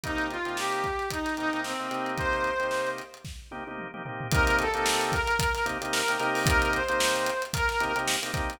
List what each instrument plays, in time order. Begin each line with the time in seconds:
0.03 drawbar organ C3 A#3 D#4 G4, brass section D#4, kick, closed hi-hat
0.18 closed hi-hat
0.30 brass section F4, closed hi-hat
0.45 drawbar organ C3 A#3 D#4 G4, closed hi-hat
0.57 brass section G4, snare
0.72 closed hi-hat
0.84 kick, closed hi-hat
0.99 snare, closed hi-hat
1.10 brass section D#4, kick, closed hi-hat
1.25 snare, closed hi-hat
1.37 drawbar organ C3 A#3 D#4 G4, brass section D#4, closed hi-hat
1.53 drawbar organ C3 A#3 D#4 G4, closed hi-hat
1.64 brass section C4, snare
1.80 drawbar organ C3 A#3 D#4 G4
1.91 drawbar organ C3 A#3 D#4 G4, snare, closed hi-hat
2.06 closed hi-hat
2.18 brass section C5, kick, closed hi-hat
2.33 closed hi-hat
2.44 closed hi-hat
2.60 drawbar organ C3 A#3 D#4 G4, closed hi-hat
2.71 snare
2.87 closed hi-hat
2.98 closed hi-hat
3.14 closed hi-hat
3.25 kick, snare
3.51 drawbar organ C3 A#3 D#4 G4, high tom
3.67 drawbar organ C3 A#3 D#4 G4, high tom
3.78 mid tom
3.94 drawbar organ C3 A#3 D#4 G4, mid tom
4.05 drawbar organ C3 A#3 D#4 G4, floor tom
4.21 floor tom
4.31 drawbar organ C3 A#3 D#4 G4, brass section A#4, kick, closed hi-hat
4.47 snare, closed hi-hat
4.59 brass section A4, closed hi-hat
4.74 drawbar organ C3 A#3 D#4 G4, snare, closed hi-hat
4.86 snare
5.01 closed hi-hat
5.12 brass section A#4, kick, closed hi-hat
5.27 closed hi-hat
5.39 kick, closed hi-hat
5.55 snare, closed hi-hat
5.65 drawbar organ C3 A#3 D#4 G4, snare, closed hi-hat
5.81 drawbar organ C3 A#3 D#4 G4, closed hi-hat
5.92 brass section A#4, snare
6.08 drawbar organ C3 A#3 D#4 G4, closed hi-hat
6.20 drawbar organ C3 A#3 D#4 G4, closed hi-hat
6.35 open hi-hat
6.46 brass section A#4, kick, closed hi-hat
6.62 closed hi-hat
6.73 brass section C5, closed hi-hat
6.89 drawbar organ C3 A#3 D#4 G4, closed hi-hat
7.00 snare
7.15 snare, closed hi-hat
7.26 closed hi-hat
7.42 closed hi-hat
7.53 brass section A#4, kick, closed hi-hat
7.69 snare, closed hi-hat
7.80 drawbar organ C3 A#3 D#4 G4, closed hi-hat
7.96 drawbar organ C3 A#3 D#4 G4, snare, closed hi-hat
8.07 snare
8.22 drawbar organ C3 A#3 D#4 G4, closed hi-hat
8.34 drawbar organ C3 A#3 D#4 G4, kick, snare, closed hi-hat
8.50 closed hi-hat